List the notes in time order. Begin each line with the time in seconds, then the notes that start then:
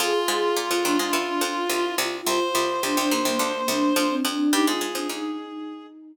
0.00 F2 F3 F4 G#4
0.28 G#2 G#3 G#4
0.55 A#2 A#3 F4
0.70 F2 F3 F4
0.83 D#2 D#3 D4
0.99 G#2 G#3 D4
1.13 E2 E3
1.27 D4
1.41 F2 F3 F4
1.69 C2 C3 F4
1.85 E4
1.98 C2 C3 F4
2.27 C2 C3 F4 C5
2.55 C2 C3 F4
2.82 C2 C3 D4
2.97 C2 C3 D4
3.11 D#2 D#3 A#3
3.25 C2 C3 A#3
3.39 D2 D3
3.55 A#3
3.68 C2 C3 D4
3.95 F2 F3 D4
4.10 C4
4.25 F2 F3 D4
4.52 G2 G3 D#4 G4
4.66 G#2 G#3 F4 G#4
4.81 G#2 G#3
4.95 F2 F3 D4
5.09 D#2 D#3 D#4